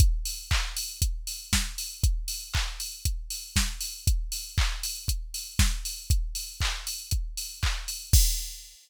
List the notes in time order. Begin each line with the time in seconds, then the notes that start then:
0.00 kick, closed hi-hat
0.25 open hi-hat
0.51 kick, clap
0.76 open hi-hat
1.02 kick, closed hi-hat
1.27 open hi-hat
1.53 kick, snare
1.78 open hi-hat
2.03 kick, closed hi-hat
2.28 open hi-hat
2.54 kick, clap
2.80 open hi-hat
3.05 kick, closed hi-hat
3.30 open hi-hat
3.56 kick, snare
3.81 open hi-hat
4.07 kick, closed hi-hat
4.32 open hi-hat
4.58 kick, clap
4.83 open hi-hat
5.08 kick, closed hi-hat
5.34 open hi-hat
5.59 kick, snare
5.85 open hi-hat
6.10 kick, closed hi-hat
6.35 open hi-hat
6.60 kick, clap
6.87 open hi-hat
7.11 kick, closed hi-hat
7.37 open hi-hat
7.63 kick, clap
7.88 open hi-hat
8.13 kick, crash